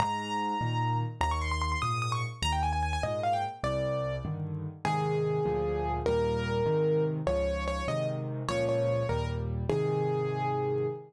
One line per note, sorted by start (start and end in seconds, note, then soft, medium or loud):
0.00 0.55 G#2 medium
0.00 0.97 A#5 loud
0.61 1.03 A#2 medium
0.61 1.03 D#3 medium
1.21 1.75 D#2 medium
1.21 1.31 A#5 loud
1.31 1.41 C#6 loud
1.41 1.51 C6 medium
1.51 1.61 C6 loud
1.62 1.71 C6 loud
1.72 1.81 C6 medium
1.82 2.25 G#2 medium
1.82 2.25 A#2 medium
1.82 2.00 D#6 medium
2.02 2.12 D#6 medium
2.12 2.22 C#6 medium
2.42 2.97 D#2 medium
2.42 2.52 A#5 loud
2.52 2.62 G5 medium
2.63 2.72 G#5 loud
2.73 2.82 G#5 medium
2.83 2.92 G#5 medium
2.93 3.03 G#5 medium
3.03 3.46 G#2 medium
3.03 3.46 A#2 medium
3.03 3.21 D#5 medium
3.23 3.33 F5 medium
3.33 3.43 G5 medium
3.63 4.18 C2 medium
3.63 4.16 D5 medium
4.25 4.67 G2 medium
4.25 4.67 D3 medium
4.25 4.67 D#3 medium
4.85 5.39 G#2 loud
4.85 5.39 C3 medium
4.85 5.39 D#3 medium
4.85 5.92 G#4 loud
5.45 6.00 D2 medium
5.45 6.00 A#2 medium
5.45 6.00 F3 medium
6.06 6.62 D#2 medium
6.06 6.62 A#2 medium
6.06 6.62 G3 medium
6.06 7.04 A#4 loud
6.66 7.20 G#2 medium
6.66 7.20 C3 medium
6.66 7.20 D#3 medium
7.27 7.81 C#2 medium
7.27 7.81 G#2 medium
7.27 7.81 F3 medium
7.27 7.64 C#5 loud
7.68 7.87 C#5 loud
7.88 8.42 G#2 medium
7.88 8.42 C3 medium
7.88 8.42 D#3 medium
7.88 8.07 D#5 loud
8.49 9.03 C#2 medium
8.49 9.03 A#2 medium
8.49 9.03 F3 medium
8.49 8.65 C#5 loud
8.69 9.07 C#5 medium
9.09 9.64 D#2 medium
9.09 9.64 A#2 medium
9.09 9.64 G3 medium
9.09 9.26 A#4 medium
9.70 10.87 G#2 medium
9.70 10.87 C3 medium
9.70 10.87 D#3 medium
9.70 10.87 G#4 loud